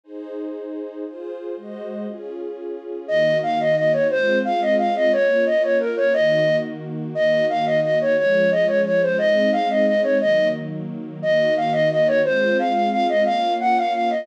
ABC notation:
X:1
M:6/8
L:1/8
Q:3/8=118
K:Ebdor
V:1 name="Flute"
z6 | z6 | z6 | e2 f e e d |
c2 f e f e | d2 e d B d | e3 z3 | e2 f e e d |
d2 e d d c | e2 f e e d | e2 z4 | e2 f e e d |
c2 f f f e | f2 g f f e |]
V:2 name="String Ensemble 1"
[EAc]6 | [FAc]3 [A,Gce]3 | [DFA]6 | [E,B,G]6 |
[A,CF]6 | [B,DF]6 | [E,B,G]6 | [E,B,G]6 |
[F,A,D]6 | [A,CE]6 | [E,G,B,]6 | [E,B,G]6 |
[A,CF]6 | [B,DF]6 |]